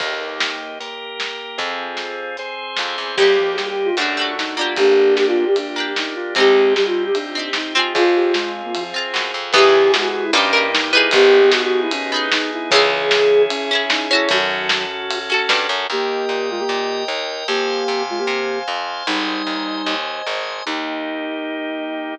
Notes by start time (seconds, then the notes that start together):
0.00 D#2 A#3 D#4 G4, kick, crash
0.40 snare
0.80 A#3 G4 A#4, closed hi-hat
1.20 snare
1.58 F2 C4 F4 G#4, kick, closed hi-hat
1.97 snare
2.37 C4 G#4 C5, closed hi-hat
2.76 F2, snare
2.98 E2
3.16 D#2 G3 A#3 D#4 G4, kick, crash
3.22 G4
3.38 F3
3.56 G3 G4, snare
3.69 G4
3.85 F4
3.97 F#2 A3 D4 F#4, ride
4.01 F#4
4.17 A3 D4
4.21 F#4
4.38 D#4, snare
4.57 A#3 D4 F4
4.61 G4
4.76 G1 A#3 D4 G4, kick, ride
5.16 G4, snare
5.27 F4
5.47 G4
5.56 D4, ride
5.76 A#3 D4
5.80 G4
5.96 D#4, snare
6.15 F4
6.35 C2 G#3 C4 D#4 G4, kick, ride
6.40 G4
6.75 G3 G4, snare
6.86 F4
7.06 G4
7.14 D4, ride
7.35 C4 D#4
7.39 G4
7.53 D#4, snare
7.75 C4 F4
7.79 G#4
7.94 F2 C4 F4 G#4, kick, ride
8.16 G4
8.34 G#3, snare
8.64 A#3
8.75 F3, ride
8.94 C4 F4
8.98 G#4
9.14 F#2, snare
9.34 F2
9.52 E2 C#3 E3 B3 E4 G4 G#4, kick, crash
9.58 G#4
9.92 G#3 F#4, snare
10.03 F#4
10.24 E4
10.32 G2 A#3 C#4 D#4 G4, ride
10.37 G4
10.53 A#3 D#4
10.57 G4
10.73 D#4, snare
10.91 B3 E4
10.95 D#4 G#4
11.11 G#1 B3 D#4 G4 G#4, kick, ride
11.42 B3
11.51 F#4, snare
11.63 F#4
11.81 E4
11.91 C#4, ride
12.12 B3 D#4
12.16 G#4
12.32 D#4, snare
12.53 E4
12.71 C#2 C#3 E3 C#4 E4 G#4, kick, ride
12.76 G#4
13.11 snare
13.49 C#4, ride
13.71 C#4 E4 G#4
13.90 D#4, snare
14.11 C#4 E4 F#4
14.15 A4
14.29 F#2 D#3 F#3 C#4 F#4 A4, kick, ride
14.69 snare
15.11 ride
15.30 C#4 F#4 A4
15.49 G2, snare
15.69 F#2
15.90 D#2 A#3 G4 A#4 D#5 G5
16.29 A#2
16.50 G#3 F4
16.60 A#3 G4
16.69 A#2
17.08 D#2
17.48 F2 A#3 G4 C5 F5 G#5
17.88 C3
18.10 G#3 F4
18.19 A#3 G4
18.27 C3
18.68 F2
19.07 G#1 G3 D#4 C5 D#5 G#5
19.47 D#2
19.86 D#2
20.27 G#1
20.66 D#2 A#3 D#4 G4